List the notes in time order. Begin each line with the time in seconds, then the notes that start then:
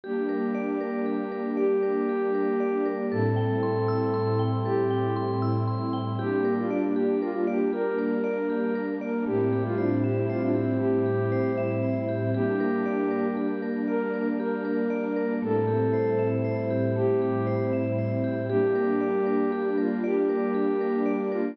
0.04 G3 A#3 D4 G4
0.29 A#4
0.55 D5
0.81 A#4
1.06 G4
1.32 A#4
1.56 G4 D5
1.83 A#4
2.09 G4
2.34 A#4
2.60 D5
2.86 A#4
3.11 A2 G3 C4 E4 A4
3.36 G5
3.63 C6
3.88 E6
4.14 C6
4.39 G5
4.65 G4 A4
4.90 G5
5.16 C6
5.42 E6
5.68 C6
5.93 G5
6.19 G3 A#3 D4 G4
6.45 A#4
6.58 F4
6.69 D4 D5
6.95 G4
7.21 F4 A#4
7.35 F4
7.47 G4 D5
7.73 G4 A#4
7.98 A#4
8.24 D5
8.50 G4
8.75 A#4
9.01 A#4 D5
9.26 A2 G3 A3 C4 E4 G4
9.52 G4
9.65 F4
9.78 D4 C5
10.03 G4 E5
10.30 F4 C5
10.43 D4
10.52 C4 G4
10.79 A3 G4
11.06 G4
11.32 C5
11.58 E5
11.83 C5
12.09 G4
12.34 G3 A#3 D4 G4
12.60 A#4
12.86 D5
13.11 A#4
13.37 G4
13.62 A#4
13.86 A#4 D5
14.14 A#4
14.39 G4 A#4
14.65 A#4
14.90 D5
15.16 A#4
15.42 A2 G3 A3 C4 E4 A4
15.67 G4
15.93 C5
16.19 E5
16.44 C5
16.70 G4
16.96 A3 G4
17.22 G4
17.47 C5
17.73 E5
17.99 C5
18.24 G4
18.49 G3 A#3 D4 G4
18.75 A#4
19.01 D5
19.26 A#4
19.52 G4
19.78 F4 A#4
20.04 G4 D5
20.29 A#4
20.54 G4
20.81 A#4
21.06 D5
21.32 F4 A#4